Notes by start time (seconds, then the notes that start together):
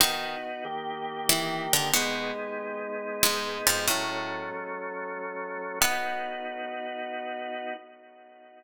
0.00 D#3 B3 D#4 F#4
0.65 D#3 A#3 G4
1.29 E3 E4
1.73 D3 D4
1.94 B2 G#3 B3 D#4
3.23 G#2 G#3
3.67 F2 F3
3.87 A2 F#3 A3 C#4
5.81 B3 D#4 F#4